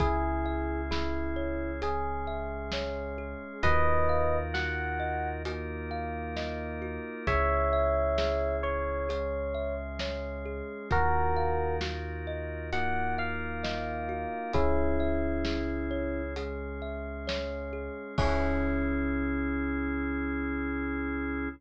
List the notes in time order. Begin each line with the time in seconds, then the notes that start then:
0.00 C#2 C#4 E4 G#4, kick, closed hi-hat
0.46 E5
0.91 E4 G#4, snare
1.36 C#5
1.82 G#3 C#4 G#4, closed hi-hat
2.27 E5
2.72 C#5, snare
3.18 G#4
3.63 D#2 D#4 F4 F#4 A#4 B4 D#5, kick, closed hi-hat
4.09 F5
4.54 F#4 F#5, snare
5.00 D#5
5.45 A#3 D#4 F4 F#4 A#4, closed hi-hat
5.91 F5
6.36 D#5, snare
6.82 F#4
7.27 C#2 C#4 E4 G#4 C#5 E5, kick, closed hi-hat
7.73 E5
8.18 G#4, snare
8.63 C#5
9.09 G#3 C#4 G#4, closed hi-hat
9.55 E5
9.99 C#5, snare
10.45 G#4
10.90 D#2 D#4 F4 F#4 A#4, kick, closed hi-hat
11.37 F5
11.81 F#4, snare
12.27 D#5
12.73 A#3 D#4 F4 F#4 A#4 F#5, closed hi-hat
13.18 F5
13.63 D#5, snare
14.09 F#4
14.53 C#2 C#4 E4 G#4, kick, closed hi-hat
15.00 E5
15.45 G#4, snare
15.91 C#5
16.36 G#3 C#4 G#4, closed hi-hat
16.82 E5
17.27 C#5, snare
17.73 G#4
18.18 C#2 C#4 E4 G#4 C#5 E5, kick, crash